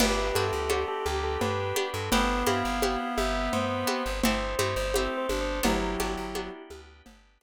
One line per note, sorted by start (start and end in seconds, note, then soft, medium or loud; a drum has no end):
0.00 0.32 G1 loud
0.00 0.31 B3 loud
0.00 1.05 B3 medium
0.00 0.31 D4 loud
0.00 1.05 D4 medium
0.00 0.31 F#4 loud
0.00 1.05 F#4 medium
0.00 0.31 G4 loud
0.00 1.05 G4 medium
0.00 1.90 G4 loud
0.00 0.34 B4 loud
0.00 crash loud
0.00 cowbell loud
0.00 low conga loud
0.35 0.51 G2 medium
0.35 0.69 B3 loud
0.35 0.69 D4 medium
0.35 0.69 F#4 medium
0.35 0.69 G4 medium
0.35 0.82 A4 loud
0.35 high conga medium
0.53 0.85 D2 medium
0.70 1.67 B3 medium
0.70 1.67 D4 medium
0.70 1.67 F#4 loud
0.70 1.67 G4 medium
0.70 cowbell medium
0.70 high conga medium
0.88 1.05 A4 loud
1.06 1.37 D2 medium
1.06 2.11 B3 medium
1.06 2.11 D4 medium
1.06 2.11 G4 medium
1.06 1.23 G4 medium
1.06 2.11 B4 medium
1.06 high conga medium
1.24 1.40 A4 medium
1.41 1.73 G2 medium
1.41 1.87 B4 loud
1.41 cowbell medium
1.41 low conga medium
1.76 2.09 B3 loud
1.76 2.09 D4 loud
1.76 2.09 F#4 medium
1.76 2.09 G4 loud
1.76 high conga medium
1.94 2.10 G2 medium
1.94 2.11 A4 medium
2.12 2.44 G1 loud
2.12 4.03 B3 loud
2.12 2.45 B3 loud
2.12 3.17 B3 medium
2.12 2.45 C4 loud
2.12 3.17 C4 medium
2.12 2.45 E4 loud
2.12 3.17 E4 medium
2.12 2.45 G4 loud
2.12 3.17 G4 medium
2.12 2.43 B4 loud
2.12 cowbell medium
2.12 low conga loud
2.46 2.63 G2 medium
2.46 2.79 B3 medium
2.46 2.79 C4 loud
2.46 2.79 E4 medium
2.46 2.79 G4 loud
2.46 3.13 F5 medium
2.46 high conga loud
2.65 2.97 G1 medium
2.82 3.80 B3 medium
2.82 3.80 C4 medium
2.82 3.80 E4 loud
2.82 3.80 G4 medium
2.82 cowbell medium
2.82 high conga loud
3.18 3.49 G1 medium
3.18 4.22 B3 medium
3.18 4.22 C4 medium
3.18 4.22 G4 medium
3.18 4.22 B4 medium
3.18 3.51 E5 loud
3.18 high conga medium
3.53 3.85 G2 medium
3.53 4.11 C5 loud
3.53 cowbell medium
3.53 low conga medium
3.87 4.20 B3 loud
3.87 4.20 C4 loud
3.87 4.20 E4 loud
3.87 4.20 G4 loud
3.87 high conga medium
4.06 4.22 G1 medium
4.23 4.55 G1 medium
4.23 4.94 A3 medium
4.23 4.57 A3 loud
4.23 4.94 C4 medium
4.23 4.57 C4 loud
4.23 4.94 E4 medium
4.23 4.57 E4 loud
4.23 4.94 G4 medium
4.23 4.57 G4 loud
4.23 4.56 C5 loud
4.23 cowbell loud
4.23 low conga loud
4.59 4.75 G2 medium
4.59 4.91 A3 loud
4.59 4.91 C4 loud
4.59 4.91 E4 loud
4.59 4.91 G4 medium
4.59 4.76 C5 medium
4.59 high conga medium
4.76 5.08 G1 medium
4.76 4.93 C5 medium
4.94 5.64 A3 medium
4.94 5.61 A3 loud
4.94 5.64 C4 medium
4.94 5.61 C4 medium
4.94 5.27 C4 medium
4.94 5.61 E4 loud
4.94 5.64 G4 medium
4.94 5.61 G4 loud
4.94 5.64 A4 medium
4.94 5.17 C5 loud
4.94 cowbell medium
4.94 high conga medium
5.18 5.40 C5 medium
5.28 5.61 G1 medium
5.28 5.59 D4 medium
5.28 high conga medium
5.41 5.64 C5 medium
5.63 5.96 G1 medium
5.63 6.50 F#3 loud
5.63 5.96 B3 loud
5.63 6.69 B3 medium
5.63 5.96 D4 loud
5.63 6.69 D4 medium
5.63 6.61 E4 medium
5.63 5.96 F#4 loud
5.63 6.69 F#4 medium
5.63 5.96 G4 loud
5.63 6.69 G4 medium
5.63 6.61 G4 loud
5.63 cowbell loud
5.63 low conga loud
6.00 6.16 G1 medium
6.00 6.32 B3 loud
6.00 6.32 D4 medium
6.00 6.32 F#4 loud
6.00 6.32 G4 loud
6.00 high conga medium
6.17 6.49 G1 medium
6.35 7.32 B3 loud
6.35 7.32 D4 medium
6.35 7.32 F#4 loud
6.35 7.32 G4 medium
6.35 cowbell medium
6.35 high conga loud
6.70 7.02 D2 medium
6.70 7.43 B3 medium
6.70 7.43 D4 medium
6.70 7.43 G4 medium
6.70 7.43 B4 medium
6.70 high conga medium
7.06 7.38 G1 medium
7.06 cowbell medium
7.06 low conga medium
7.41 7.43 B3 loud
7.41 7.43 D4 medium
7.41 7.43 F#4 medium
7.41 7.43 G4 loud
7.41 high conga medium